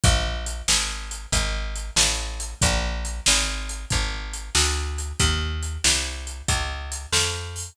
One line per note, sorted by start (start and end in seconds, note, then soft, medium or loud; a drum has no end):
0.04 0.62 A#1 loud
0.04 kick loud
0.04 closed hi-hat loud
0.46 closed hi-hat medium
0.68 1.26 G#1 medium
0.68 snare loud
1.11 closed hi-hat medium
1.32 1.90 G#1 loud
1.32 kick loud
1.32 closed hi-hat loud
1.76 closed hi-hat medium
1.96 2.54 A1 loud
1.96 snare loud
2.40 closed hi-hat medium
2.62 3.21 A#1 loud
2.62 kick loud
2.62 closed hi-hat loud
3.05 closed hi-hat medium
3.26 3.85 G#1 loud
3.26 snare loud
3.69 closed hi-hat medium
3.90 4.50 G#1 medium
3.90 kick loud
3.90 closed hi-hat loud
4.33 closed hi-hat medium
4.55 5.13 D2 loud
4.55 snare loud
4.98 closed hi-hat medium
5.19 5.78 D#2 loud
5.19 kick loud
5.19 closed hi-hat loud
5.63 closed hi-hat medium
5.84 6.42 C2 loud
5.84 snare loud
6.27 closed hi-hat medium
6.48 7.06 C#2 medium
6.48 kick loud
6.48 closed hi-hat loud
6.92 closed hi-hat loud
7.12 7.71 F2 loud
7.12 snare loud
7.56 open hi-hat medium